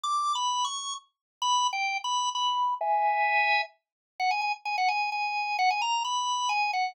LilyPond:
\new Staff { \time 3/4 \key b \major \tempo 4 = 130 \tuplet 3/2 { d'''4 b''4 cis'''4 } r4 | \tuplet 3/2 { b''4 g''4 b''4 } b''4 | <e'' gis''>2 r4 | fis''16 gis''16 gis''16 r16 gis''16 fis''16 gis''8 gis''4 |
fis''16 gis''16 ais''8 b''4 gis''8 fis''8 | }